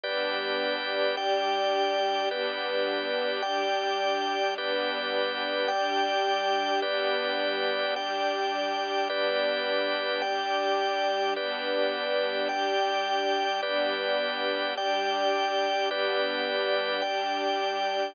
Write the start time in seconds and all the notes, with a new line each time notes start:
0.04 G3 B3 D4 G4 B4 D5
1.16 G3 D4 G4 D5 G5
2.30 G3 B3 D4 G4 B4 D5
3.42 G3 D4 G4 D5 G5
4.57 G3 B3 D4 G4 B4 D5
5.68 G3 D4 G4 D5 G5
6.82 G3 B3 D4 G4 B4 D5
7.95 G3 D4 G4 D5 G5
9.10 G3 B3 D4 G4 B4 D5
10.22 G3 D4 G4 D5 G5
11.36 G3 B3 D4 G4 B4 D5
12.48 G3 D4 G4 D5 G5
13.61 G3 B3 D4 G4 B4 D5
14.76 G3 D4 G4 D5 G5
15.88 G3 B3 D4 G4 B4 D5
17.02 G3 D4 G4 D5 G5